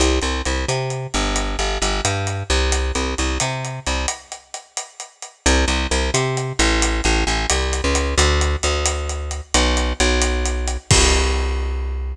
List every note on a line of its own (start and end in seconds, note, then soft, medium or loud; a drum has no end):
0.00 0.19 C2 medium
0.00 closed hi-hat medium
0.21 0.42 C2 medium
0.21 closed hi-hat medium
0.45 0.65 C2 medium
0.45 closed hi-hat medium
0.68 1.07 C3 medium
0.68 closed hi-hat medium
0.90 closed hi-hat medium
1.14 1.56 G1 medium
1.14 closed hi-hat medium
1.36 closed hi-hat medium
1.59 1.78 G1 medium
1.59 closed hi-hat medium
1.82 2.01 G1 medium
1.82 closed hi-hat medium
2.05 2.43 G2 medium
2.05 closed hi-hat medium
2.27 closed hi-hat medium
2.50 2.92 C2 medium
2.50 closed hi-hat medium
2.72 closed hi-hat medium
2.95 3.15 C2 medium
2.95 closed hi-hat medium
3.18 3.38 C2 medium
3.18 closed hi-hat medium
3.40 3.80 C3 medium
3.40 closed hi-hat medium
3.65 closed hi-hat medium
3.86 4.06 C2 medium
3.86 closed hi-hat medium
4.08 closed hi-hat medium
4.32 closed hi-hat medium
4.54 closed hi-hat medium
4.77 closed hi-hat medium
5.00 closed hi-hat medium
5.22 closed hi-hat medium
5.46 5.65 C2 loud
5.46 closed hi-hat medium
5.68 5.87 C2 medium
5.68 closed hi-hat medium
5.91 6.11 C2 medium
5.91 closed hi-hat medium
6.14 6.53 C3 medium
6.14 closed hi-hat medium
6.37 closed hi-hat medium
6.59 7.01 A1 loud
6.59 closed hi-hat medium
6.82 closed hi-hat medium
7.04 7.24 A1 loud
7.04 closed hi-hat medium
7.27 7.46 A1 medium
7.27 closed hi-hat medium
7.50 7.81 C2 medium
7.50 closed hi-hat loud
7.73 closed hi-hat medium
7.84 8.15 C#2 medium
7.95 closed hi-hat medium
8.18 8.56 D2 loud
8.18 closed hi-hat medium
8.41 closed hi-hat medium
8.63 9.41 D2 medium
8.63 closed hi-hat medium
8.86 closed hi-hat medium
9.09 closed hi-hat medium
9.31 closed hi-hat medium
9.54 9.93 B1 loud
9.54 closed hi-hat loud
9.77 closed hi-hat medium
10.00 10.77 B1 loud
10.00 closed hi-hat medium
10.21 closed hi-hat medium
10.45 closed hi-hat medium
10.68 closed hi-hat medium
10.91 12.14 C2 loud
10.91 kick loud
10.91 crash loud